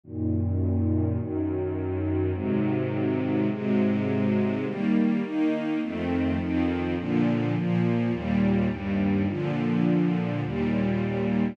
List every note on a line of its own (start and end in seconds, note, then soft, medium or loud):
0.03 1.18 F#2 medium
0.03 1.18 A#2 medium
0.03 1.18 D#3 medium
1.19 2.33 F#2 medium
1.19 2.33 D#3 medium
1.19 2.33 F#3 medium
2.34 3.48 G#2 medium
2.34 3.48 C3 medium
2.34 3.48 D#3 medium
2.34 3.48 F#3 medium
3.50 4.65 G#2 medium
3.50 4.65 C3 medium
3.50 4.65 F#3 medium
3.50 4.65 G#3 medium
4.65 5.22 D#3 medium
4.65 5.22 G3 medium
4.65 5.22 A#3 medium
5.23 5.80 D#3 medium
5.23 5.80 A#3 medium
5.23 5.80 D#4 medium
5.81 6.38 F2 medium
5.81 6.38 D#3 medium
5.81 6.38 A3 medium
5.81 6.38 C4 medium
6.38 6.95 F2 medium
6.38 6.95 D#3 medium
6.38 6.95 F3 medium
6.38 6.95 C4 medium
6.97 7.54 A#2 medium
6.97 7.54 D3 medium
6.97 7.54 F3 medium
7.55 8.11 A#2 medium
7.55 8.12 F3 medium
7.55 8.12 A#3 medium
8.11 8.68 D#2 medium
8.11 8.68 A#2 medium
8.11 8.68 G3 medium
8.69 9.26 D#2 medium
8.69 9.26 G2 medium
8.69 9.26 G3 medium
9.27 10.42 A#2 medium
9.27 10.42 D3 medium
9.27 10.42 F3 medium
10.42 11.56 D#2 medium
10.42 11.56 A#2 medium
10.42 11.56 G3 medium